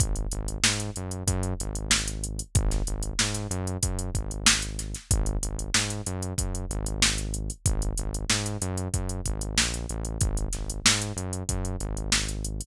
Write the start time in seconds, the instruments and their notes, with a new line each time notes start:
0.00 synth bass 1 G#1, kick, closed hi-hat
0.16 closed hi-hat
0.32 synth bass 1 G#1, closed hi-hat
0.48 closed hi-hat
0.63 synth bass 1 G#2, snare
0.80 closed hi-hat
0.96 synth bass 1 F#2, closed hi-hat
1.11 closed hi-hat
1.27 synth bass 1 F#2, kick, closed hi-hat
1.43 closed hi-hat
1.60 synth bass 1 G#1, closed hi-hat
1.75 closed hi-hat
1.91 snare
2.08 closed hi-hat
2.24 closed hi-hat
2.39 closed hi-hat
2.55 synth bass 1 G#1, kick, closed hi-hat
2.71 snare, closed hi-hat
2.87 synth bass 1 G#1, closed hi-hat
3.03 closed hi-hat
3.19 synth bass 1 G#2, snare
3.34 snare, closed hi-hat
3.50 synth bass 1 F#2, closed hi-hat
3.67 closed hi-hat
3.83 synth bass 1 F#2, kick, closed hi-hat
3.99 closed hi-hat
4.14 synth bass 1 G#1, kick, closed hi-hat
4.31 closed hi-hat
4.46 snare
4.62 closed hi-hat
4.79 snare, closed hi-hat
4.95 snare, closed hi-hat
5.11 synth bass 1 G#1, kick, closed hi-hat
5.26 closed hi-hat
5.43 synth bass 1 G#1, closed hi-hat
5.59 closed hi-hat
5.74 synth bass 1 G#2, snare
5.90 closed hi-hat
6.06 synth bass 1 F#2, closed hi-hat
6.22 closed hi-hat
6.38 synth bass 1 F#2, kick, closed hi-hat
6.55 closed hi-hat
6.70 synth bass 1 G#1, closed hi-hat
6.86 closed hi-hat
7.02 snare
7.18 closed hi-hat
7.34 closed hi-hat
7.50 closed hi-hat
7.66 synth bass 1 G#1, kick, closed hi-hat
7.82 closed hi-hat
7.97 synth bass 1 G#1, closed hi-hat
8.14 closed hi-hat
8.30 synth bass 1 G#2, snare
8.46 closed hi-hat
8.61 synth bass 1 F#2, closed hi-hat
8.78 closed hi-hat
8.94 synth bass 1 F#2, kick, closed hi-hat
9.09 closed hi-hat
9.26 synth bass 1 G#1, kick, closed hi-hat
9.41 closed hi-hat
9.57 synth bass 1 A#1, snare
9.74 closed hi-hat
9.89 synth bass 1 A1, closed hi-hat
10.05 closed hi-hat
10.21 synth bass 1 G#1, kick, closed hi-hat
10.37 closed hi-hat
10.53 synth bass 1 G#1, snare, closed hi-hat
10.70 closed hi-hat
10.85 synth bass 1 G#2, snare
11.02 closed hi-hat
11.16 synth bass 1 F#2, closed hi-hat
11.33 closed hi-hat
11.49 synth bass 1 F#2, kick, closed hi-hat
11.65 closed hi-hat
11.80 synth bass 1 G#1, closed hi-hat
11.97 closed hi-hat
12.12 snare
12.29 closed hi-hat
12.45 closed hi-hat
12.61 closed hi-hat